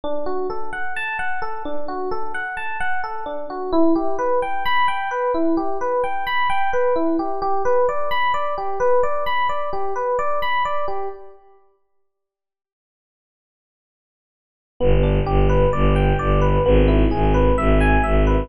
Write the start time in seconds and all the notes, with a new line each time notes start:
0.04 D4
0.26 F#4
0.50 A4
0.73 F#5
0.96 A5
1.19 F#5
1.42 A4
1.65 D4
1.88 F#4
2.11 A4
2.34 F#5
2.57 A5
2.80 F#5
3.03 A4
3.26 D4
3.50 F#4
3.73 E4
3.95 G4
4.18 B4
4.42 G5
4.66 B5
4.88 G5
5.11 B4
5.34 E4
5.57 G4
5.81 B4
6.04 G5
6.27 B5
6.50 G5
6.73 B4
6.96 E4
7.19 G4
7.42 G4
7.65 B4
7.89 D5
8.11 B5
8.34 D5
8.58 G4
8.80 B4
9.03 D5
9.26 B5
9.49 D5
9.73 G4
9.96 B4
10.19 D5
10.42 B5
10.65 D5
10.88 G4
14.80 G1 B3
15.03 D4
15.26 G1 G4
15.49 B4
15.73 G1 D5
15.96 G5
16.19 G1 D5
16.41 B4
16.65 G#1 B3
16.88 E4
17.11 G#1 G#4
17.34 B4
17.58 G#1 E5
17.80 G#5
18.03 G#1 E5
18.27 B4